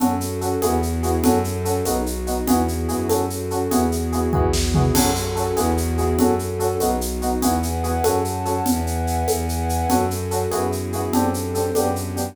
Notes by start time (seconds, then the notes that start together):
0.00 F#2 C#4 F#4 A4, low conga, shaker
0.21 shaker
0.41 C#4 F#4 A4, shaker
0.62 E2 B3 E4 F#4 G#4, high conga, shaker
0.83 shaker
1.03 B3 E4 F#4 G#4, shaker
1.24 F#2 C#4 F#4 A4, low conga, shaker
1.44 shaker
1.65 C#4 F#4 A4, shaker
1.85 B1 B3 D#4 F#4, high conga, shaker
2.06 shaker
2.27 B3 D#4 F#4, shaker
2.47 E2 B3 E4 F#4 G#4, low conga, shaker
2.68 shaker
2.88 F#2 B3 E4 F#4 G#4, shaker
3.09 C#4 F#4 A4, high conga, shaker
3.30 shaker
3.51 C#4 F#4 A4, shaker
3.71 E2 B3 E4 F#4 G#4, low conga, shaker
3.92 shaker
4.12 B3 E4 F#4 G#4, shaker
4.33 E2 B3 E4 F#4 G#4, kick
4.53 snare
4.74 B3 E4 F#4 G#4, floor tom
4.94 F#2 C#4 F#4 A4, crash, low conga, shaker
5.15 shaker
5.35 C#4 F#4 A4, shaker
5.56 E2 B3 E4 F#4 G#4, high conga, shaker
5.77 shaker
5.98 B3 E4 F#4 G#4, shaker
6.19 F#2 C#4 F#4 A4, low conga, shaker
6.39 shaker
6.59 C#4 F#4 A4, shaker
6.80 B1 B3 D#4 F#4, high conga, shaker
7.01 shaker
7.22 B3 D#4 F#4, shaker
7.42 E2 B3 E4 F#4 G#4 B4 E5 F#5 G#5, low conga, shaker
7.63 shaker
7.84 B3 E4 F#4 G#4, shaker
8.04 F#2 C#4 F#4 A4 C#5 F#5 A5, high conga, shaker
8.25 shaker
8.45 C#4 F#4 A4, shaker
8.65 E2 B4 E5 F#5 G#5, low conga, shaker
8.87 shaker
9.07 shaker
9.27 E2 B4 E5 F#5 G#5, high conga, shaker
9.49 shaker
9.69 shaker
9.89 F#2 C#4 F#4 A4, low conga, shaker
10.11 shaker
10.31 C#4 F#4 A4, shaker
10.51 F#2 B3 E4 F#4 G#4, high conga, shaker
10.72 shaker
10.93 B3 E4 F#4 G#4, shaker
11.12 F#2 C4 D4 G4 A4, low conga, shaker
11.34 shaker
11.55 C4 D4 G4 A4, shaker
11.75 F#2 B3 D4 G4, high conga, shaker
11.96 shaker
12.16 B3 D4 G4, shaker